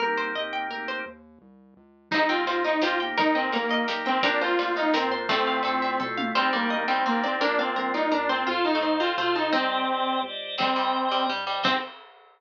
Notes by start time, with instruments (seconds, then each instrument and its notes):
0.00 synth bass 1 C2, drawbar organ A#3 C4 D#4, pizzicato strings A#4
0.06 drawbar organ G4
0.17 pizzicato strings C5
0.34 synth bass 1 D#2, drawbar organ A#3 C4 D#4, pizzicato strings D#5
0.40 drawbar organ G4
0.53 pizzicato strings G5
0.69 synth bass 1 D2, drawbar organ A#3 C4, pizzicato strings A#4
0.73 drawbar organ D#4 G4
0.88 pizzicato strings C5
1.06 synth bass 1 D#2
1.42 synth bass 1 C2
1.77 synth bass 1 C#2
2.11 synth bass 1 C2, drawbar organ C4 D#4 G4, lead 2 (sawtooth) D#4, pizzicato strings D#4 C5, kick, crash
2.29 pizzicato strings C4 G5, lead 2 (sawtooth) F4, ride
2.45 synth bass 1 D#2, drawbar organ C4 D#4, pizzicato strings C5, ride
2.51 drawbar organ G4
2.64 lead 2 (sawtooth) D#4, pizzicato strings D#5, ride
2.81 synth bass 1 E2, drawbar organ C4 D#4, lead 2 (sawtooth) F4, pizzicato strings G4 C5, snare
2.86 drawbar organ G4
3.00 drawbar organ A#3 D#4 G4, pizzicato strings G5, ride
3.17 synth bass 1 D#2, lead 2 (sawtooth) D#4, pizzicato strings A#4, kick, ride
3.35 lead 2 (sawtooth) C4, pizzicato strings D#5 G5, ride
3.52 synth bass 1 A#1, drawbar organ A#3 D#4, lead 2 (sawtooth) A#3, pizzicato strings A#4, ride
3.57 drawbar organ G4
3.69 pizzicato strings D#5, ride
3.88 synth bass 1 B1, drawbar organ A#3 D#4, pizzicato strings G4 A#4, snare
3.93 drawbar organ G4
4.05 lead 2 (sawtooth) C4, pizzicato strings G5, ride
4.22 synth bass 1 A#1, drawbar organ A#3 C4, lead 2 (sawtooth) D4, pizzicato strings G4 A#4, kick, ride
4.27 drawbar organ D4 F4
4.41 lead 2 (sawtooth) F4, pizzicato strings C5, ride
4.59 synth bass 1 D2, drawbar organ A#3 C4 D4, pizzicato strings D5, ride
4.65 drawbar organ F4
4.76 lead 2 (sawtooth) D#4, pizzicato strings F5, ride
4.94 synth bass 1 F#2, drawbar organ A#3 C4, lead 2 (sawtooth) C4, pizzicato strings A#4, snare
4.98 drawbar organ D4 F4
5.10 synth bass 1 F2, pizzicato strings C5, ride
5.29 pizzicato strings F3 A3 A4, drawbar organ A3 C4, lead 2 (sawtooth) C4, kick, ride
5.33 drawbar organ E4 F4
5.47 pizzicato strings F5, ride
5.63 synth bass 1 G2, drawbar organ A3 C4, pizzicato strings A4, ride
5.68 drawbar organ E4 F4
5.82 pizzicato strings E5, ride
5.99 synth bass 1 B2, drawbar organ A3 C4 E4, pizzicato strings A4, kick, floor tom
6.05 drawbar organ F4
6.17 pizzicato strings F5, high tom
6.35 synth bass 1 C2, pizzicato strings G3 C5, drawbar organ C4 D4 D#4, lead 2 (sawtooth) C4
6.41 drawbar organ G4
6.53 pizzicato strings G3 D5, lead 2 (sawtooth) A#3
6.70 synth bass 1 D2, drawbar organ C4 D4 D#4, pizzicato strings D#5
6.76 drawbar organ G4
6.88 pizzicato strings G3 G5, lead 2 (sawtooth) C4
7.06 synth bass 1 A1, lead 2 (sawtooth) A#3, pizzicato strings C4 C5, drawbar organ C4 D4
7.10 drawbar organ D#4 G4
7.23 lead 2 (sawtooth) C4, pizzicato strings D5
7.40 synth bass 1 A#1, pizzicato strings A#3 D4 A#4, drawbar organ A#3 D4, lead 2 (sawtooth) D4
7.46 drawbar organ F4
7.58 lead 2 (sawtooth) C4, pizzicato strings F5
7.76 synth bass 1 C2, drawbar organ A#3 D4 F4, pizzicato strings A#4
7.94 lead 2 (sawtooth) D#4, pizzicato strings D5
8.12 synth bass 1 F#2, drawbar organ A#3 D4 F4, lead 2 (sawtooth) D4, pizzicato strings A#4
8.29 lead 2 (sawtooth) C4, pizzicato strings C5
8.46 synth bass 1 F2, pizzicato strings F4, lead 2 (sawtooth) F4, drawbar organ A4 C5 F5
8.65 lead 2 (sawtooth) D#4, pizzicato strings A5
8.75 pizzicato strings A3
8.81 synth bass 1 G2, drawbar organ A4 C5, pizzicato strings C5
8.86 drawbar organ F5
9.00 pizzicato strings C4 F5, lead 2 (sawtooth) F4
9.17 synth bass 1 B2, pizzicato strings A3 C5, lead 2 (sawtooth) F4, drawbar organ A4 C5 F5
9.35 lead 2 (sawtooth) D#4, pizzicato strings A5
9.52 synth bass 1 C2, pizzicato strings C4 D#4, lead 2 (sawtooth) C4, drawbar organ G4 C5
9.57 drawbar organ D5 D#5
9.88 synth bass 1 A#1, drawbar organ G4 C5 D5
9.94 drawbar organ D#5
10.23 synth bass 1 C#2, drawbar organ G4 C5
10.27 drawbar organ D5 D#5
10.58 synth bass 1 C2, pizzicato strings G3, lead 2 (sawtooth) C4, drawbar organ C5 D#5, kick, crash
10.62 drawbar organ G5
10.71 drawbar organ C5 D#5 G5
10.76 pizzicato strings G3
11.05 drawbar organ C5 D#5 G5
11.11 pizzicato strings G3
11.29 synth bass 1 G2, pizzicato strings G3
11.46 pizzicato strings G3, drawbar organ C5 D#5 G5
11.59 drawbar organ C5 D#5 G5
11.63 synth bass 1 C2, drawbar organ C4 D#4, lead 2 (sawtooth) C4, pizzicato strings C4, kick, crash
11.68 drawbar organ G4